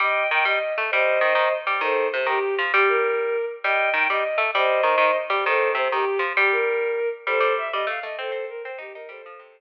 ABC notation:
X:1
M:6/8
L:1/8
Q:3/8=132
K:Cdor
V:1 name="Violin"
[eg]2 g e2 z | [ce]5 z | [Ac]2 c G2 z | G B4 z |
[eg]2 g e2 z | [ce]5 z | [Ac]2 c G2 z | G B4 z |
[Ac]2 _f e =f e | [Ac]2 B c G B | [Ac]5 z |]
V:2 name="Pizzicato Strings"
G,2 E, G, z A, | G,2 E, E, z G, | E,2 C, E, z F, | G,5 z |
G,2 E, G, z A, | G,2 E, E, z G, | E,2 C, E, z F, | G,5 z |
G, G,2 G, A, A, | C C2 C E E | G, F, C,3 z |]